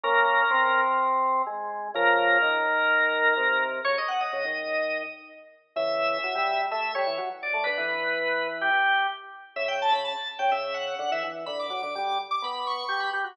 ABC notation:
X:1
M:4/4
L:1/16
Q:1/4=126
K:Abmix
V:1 name="Drawbar Organ"
B8 z8 | B16 | d e g e7 z6 | [K:Amix] e8 e2 c2 z2 d2 |
B8 G4 z4 | e g a b a2 z g e2 f2 f e z2 | b d' d' d' d'2 z d' b2 c'2 c' b z2 |]
V:2 name="Drawbar Organ"
[B,D]4 C8 A,4 | [D,F,]4 E,8 C,4 | D, z3 D, E,5 z6 | [K:Amix] [C,E,]4 F, G,3 A,2 G, E, F, z2 A, |
D, E,9 z6 | C,3 C,2 z2 C, C,4 D, E, E,2 | D,2 F, D, G,2 z2 B,4 G2 G F |]